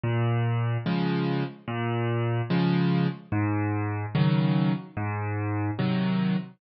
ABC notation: X:1
M:4/4
L:1/8
Q:1/4=73
K:Fm
V:1 name="Acoustic Grand Piano" clef=bass
B,,2 [D,F,A,]2 B,,2 [D,F,A,]2 | A,,2 [D,E,_G,]2 A,,2 [C,E,G,]2 |]